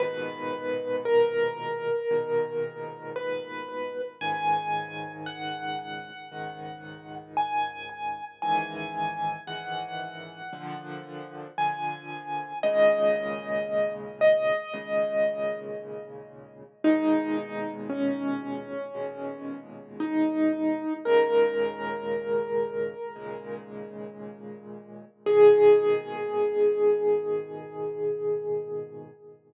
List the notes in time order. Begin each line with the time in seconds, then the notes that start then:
0.00 G#2 A#2 B2 D#3 B4
1.05 A#4
2.11 G#2 A#2 B2 D#3
3.16 B4
4.21 C#2 G#2 D#3 G#5
5.26 F#5
6.32 C#2 G#2 D#3
7.37 G#5
8.42 C#2 G#2 D#3 E3 G#5
9.47 C#2 G#2 D#3 E3 F#5
10.53 A#2 D3 F3
11.58 A#2 D3 F3 G#5
12.63 D#2 A#2 C#3 G#3 D#5
14.21 D#5
14.74 D#2 A#2 C#3 G#3
16.84 D#2 A#2 B2 G#3 D#4
17.89 C#4
18.95 D#2 A#2 B2 G#3
20.00 D#4
21.05 D#2 A#2 C#3 G#3 A#4
23.16 D#2 A#2 C#3 G#3
25.26 G#2 A#2 B2 D#3 G#4